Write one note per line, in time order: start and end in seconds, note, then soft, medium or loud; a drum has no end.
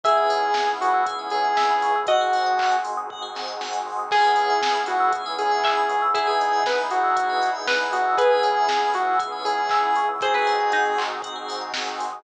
0.03 0.27 C#2 loud
0.03 2.05 B3 medium
0.03 1.88 B3 loud
0.03 2.05 C#4 medium
0.03 1.88 C#4 loud
0.03 2.05 E4 medium
0.03 1.88 E4 loud
0.03 2.05 G#4 medium
0.03 1.88 G#4 loud
0.03 0.16 G#4 medium
0.03 0.69 G#4 medium
0.03 0.50 E5 loud
0.03 kick loud
0.03 closed hi-hat loud
0.17 0.29 B4 medium
0.29 0.50 C#2 medium
0.29 0.41 C#5 medium
0.29 open hi-hat medium
0.43 0.54 E5 medium
0.54 0.78 C#2 medium
0.54 0.67 G#5 medium
0.54 kick medium
0.54 snare loud
0.68 0.79 B5 medium
0.81 1.04 C#2 medium
0.81 1.04 F#4 medium
0.81 0.93 C#6 medium
0.81 open hi-hat medium
0.94 1.05 E6 medium
1.06 1.27 C#2 medium
1.06 1.18 G#4 medium
1.06 kick medium
1.06 closed hi-hat loud
1.19 1.31 B4 medium
1.30 1.54 C#2 medium
1.30 1.98 G#4 medium
1.30 1.44 C#5 medium
1.30 open hi-hat medium
1.44 1.56 E5 medium
1.57 1.80 C#2 medium
1.57 2.04 E5 medium
1.57 1.68 G#5 medium
1.57 kick medium
1.57 snare loud
1.70 1.82 B5 medium
1.81 2.03 C#2 medium
1.81 1.94 C#6 medium
1.81 open hi-hat medium
1.96 2.07 E6 medium
2.06 2.28 G#1 medium
2.06 4.09 C4 medium
2.06 4.09 D#4 medium
2.06 4.09 F#4 medium
2.06 2.19 F#4 medium
2.06 2.76 F#4 medium
2.06 4.09 G#4 medium
2.06 2.70 D#5 medium
2.06 kick loud
2.06 closed hi-hat loud
2.21 2.33 G#4 medium
2.33 2.57 G#1 medium
2.33 2.45 C5 medium
2.33 open hi-hat medium
2.46 2.58 D#5 medium
2.58 2.80 G#1 medium
2.58 2.70 F#5 medium
2.58 kick medium
2.58 clap loud
2.72 2.83 G#5 medium
2.84 3.06 G#1 medium
2.84 2.96 C6 medium
2.84 open hi-hat medium
2.97 3.09 D#6 medium
3.10 3.32 G#1 medium
3.10 3.22 F#4 medium
3.10 kick medium
3.22 3.34 G#4 medium
3.35 3.57 G#1 medium
3.35 3.47 C5 medium
3.35 snare medium
3.48 3.59 D#5 medium
3.60 3.82 G#1 medium
3.60 3.72 F#5 medium
3.60 snare medium
3.73 3.84 G#5 medium
3.85 4.07 G#1 medium
3.85 3.98 C6 medium
3.99 4.10 D#6 medium
4.11 4.34 C#2 medium
4.11 6.13 B3 medium
4.11 5.95 B3 loud
4.11 6.13 C#4 medium
4.11 5.95 C#4 loud
4.11 6.13 E4 medium
4.11 5.95 E4 loud
4.11 4.22 G#4 medium
4.11 6.13 G#4 medium
4.11 4.77 G#4 medium
4.11 4.61 G#4 medium
4.11 5.95 G#4 loud
4.11 kick loud
4.11 crash loud
4.24 4.36 B4 medium
4.36 4.57 C#2 medium
4.36 4.49 C#5 medium
4.36 open hi-hat medium
4.50 4.61 E5 medium
4.62 4.84 C#2 medium
4.62 4.74 G#5 medium
4.62 kick medium
4.62 snare loud
4.75 4.86 B5 medium
4.86 5.10 C#2 medium
4.86 5.12 F#4 medium
4.86 4.99 C#6 medium
4.86 open hi-hat medium
5.00 5.12 E6 medium
5.13 5.36 C#2 medium
5.13 5.24 G#4 medium
5.13 kick medium
5.13 closed hi-hat loud
5.26 5.37 B4 medium
5.39 5.62 C#2 medium
5.39 6.03 G#4 medium
5.39 5.50 C#5 medium
5.39 open hi-hat medium
5.51 5.63 E5 medium
5.63 5.85 C#2 medium
5.63 6.06 E5 medium
5.63 5.76 G#5 medium
5.63 kick medium
5.63 clap loud
5.77 5.89 B5 medium
5.89 6.11 C#2 medium
5.89 6.01 C#6 medium
5.89 open hi-hat medium
6.02 6.14 E6 medium
6.14 6.36 E2 medium
6.14 8.16 B3 medium
6.14 7.98 B3 loud
6.14 8.16 D#4 medium
6.14 7.98 D#4 loud
6.14 6.58 E4 medium
6.14 8.16 E4 medium
6.14 7.98 E4 loud
6.14 6.26 G#4 medium
6.14 8.16 G#4 medium
6.14 7.98 G#4 loud
6.14 kick loud
6.14 closed hi-hat loud
6.27 6.63 G#4 medium
6.27 6.39 B4 medium
6.40 6.63 E2 medium
6.40 6.52 D#5 medium
6.40 open hi-hat medium
6.53 6.64 E5 medium
6.64 6.88 E2 medium
6.64 6.79 B4 medium
6.64 6.77 G#5 medium
6.64 kick loud
6.64 snare loud
6.78 6.90 B5 medium
6.91 7.14 E2 medium
6.91 7.50 F#4 medium
6.91 7.03 D#6 medium
6.91 open hi-hat medium
7.03 7.15 E6 medium
7.17 7.39 E2 medium
7.17 7.28 G#4 medium
7.17 kick medium
7.17 closed hi-hat loud
7.30 7.41 B4 medium
7.42 7.65 E2 medium
7.42 7.53 D#5 medium
7.42 open hi-hat medium
7.55 7.66 E5 medium
7.67 7.89 E2 medium
7.67 8.12 B4 medium
7.67 7.79 G#5 medium
7.67 kick medium
7.67 snare loud
7.80 7.91 B5 medium
7.93 8.14 E2 medium
7.93 8.15 F#4 medium
7.93 8.04 D#6 medium
7.93 open hi-hat medium
8.06 8.17 E6 medium
8.17 8.41 C#2 medium
8.17 10.00 B3 loud
8.17 10.19 B3 medium
8.17 10.00 C#4 loud
8.17 10.19 C#4 medium
8.17 10.00 E4 loud
8.17 10.19 E4 medium
8.17 8.90 G#4 medium
8.17 10.00 G#4 loud
8.17 8.29 G#4 medium
8.17 10.19 G#4 medium
8.17 8.61 B4 medium
8.17 kick loud
8.17 closed hi-hat loud
8.31 8.42 B4 medium
8.43 8.65 C#2 medium
8.43 8.55 C#5 medium
8.43 open hi-hat medium
8.56 8.68 E5 medium
8.69 8.90 C#2 medium
8.69 8.81 G#5 medium
8.69 kick medium
8.69 snare loud
8.82 8.93 B5 medium
8.94 9.16 C#2 medium
8.94 9.16 F#4 medium
8.94 9.06 C#6 medium
8.94 open hi-hat medium
9.07 9.19 E6 medium
9.19 9.42 C#2 medium
9.19 9.31 G#4 medium
9.19 kick loud
9.19 closed hi-hat loud
9.32 9.44 B4 medium
9.45 9.67 C#2 medium
9.45 10.06 G#4 medium
9.45 9.57 C#5 medium
9.45 open hi-hat medium
9.58 9.69 E5 medium
9.69 9.93 C#2 medium
9.69 10.19 E5 medium
9.69 9.82 G#5 medium
9.69 kick loud
9.69 clap loud
9.83 9.95 B5 medium
9.96 10.20 C#2 medium
9.96 10.08 C#6 medium
9.96 open hi-hat medium
10.09 10.20 E6 medium
10.21 10.43 G#1 loud
10.21 12.22 C4 medium
10.21 12.04 C4 loud
10.21 12.22 D#4 medium
10.21 12.04 D#4 loud
10.21 12.22 F#4 medium
10.21 12.04 F#4 loud
10.21 10.33 F#4 medium
10.21 12.22 G#4 medium
10.21 12.04 G#4 loud
10.21 10.96 G#4 medium
10.21 10.35 C5 medium
10.21 kick loud
10.21 closed hi-hat loud
10.34 10.46 G#4 medium
10.34 10.69 B4 medium
10.47 10.70 G#1 medium
10.47 10.58 C5 medium
10.47 open hi-hat medium
10.60 10.72 D#5 medium
10.72 10.95 G#1 medium
10.72 11.35 D#4 medium
10.72 10.83 F#5 medium
10.72 kick medium
10.72 closed hi-hat loud
10.85 10.97 G#5 medium
10.98 11.19 G#1 medium
10.98 11.10 C6 medium
10.98 clap loud
11.11 11.22 D#6 medium
11.22 11.43 G#1 medium
11.22 11.35 F#4 medium
11.22 kick medium
11.22 closed hi-hat loud
11.36 11.47 G#4 medium
11.49 11.72 G#1 medium
11.49 11.60 C5 medium
11.49 open hi-hat loud
11.61 11.73 D#5 medium
11.73 11.95 G#1 medium
11.73 11.86 F#5 medium
11.73 kick medium
11.73 snare loud
11.87 11.99 G#5 medium
11.99 12.20 G#1 medium
11.99 12.11 C6 medium
11.99 open hi-hat medium
12.13 12.23 D#6 medium